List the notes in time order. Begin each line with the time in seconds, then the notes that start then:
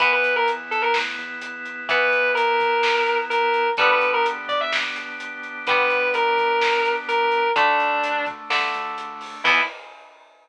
0.00 E2 E3 B3 E4 B4, kick, closed hi-hat
0.13 B4
0.24 closed hi-hat
0.36 A#4
0.48 closed hi-hat
0.71 A4, closed hi-hat
0.82 A#4
0.94 A2, snare
1.18 E2, closed hi-hat
1.42 closed hi-hat
1.65 closed hi-hat
1.89 E3 B3 B4, kick, closed hi-hat
2.12 closed hi-hat
2.35 A#4, closed hi-hat
2.60 kick, closed hi-hat
2.83 snare
3.07 closed hi-hat
3.30 A#4, closed hi-hat
3.54 closed hi-hat
3.77 G1 D3 G3 B3 D4 G4 B4, kick, closed hi-hat
3.81 B3
3.90 B4
4.01 closed hi-hat
4.14 A#4
4.26 closed hi-hat
4.48 D5, kick, closed hi-hat
4.61 E5
4.72 C2, snare
4.96 G1, closed hi-hat
5.20 closed hi-hat
5.43 closed hi-hat
5.67 D3 G3 B3 B4, kick, closed hi-hat
5.90 kick, closed hi-hat
6.14 A#4, closed hi-hat
6.38 kick, closed hi-hat
6.62 snare
6.85 closed hi-hat
7.08 A#4, closed hi-hat
7.32 closed hi-hat
7.56 D2 D3 A3 D4, kick, closed hi-hat
7.80 closed hi-hat
8.04 closed hi-hat
8.26 kick, closed hi-hat
8.49 G2 D3 A3, snare
8.74 D2, closed hi-hat
8.98 closed hi-hat
9.21 open hi-hat
9.44 E2 E3 B3 E4, kick, crash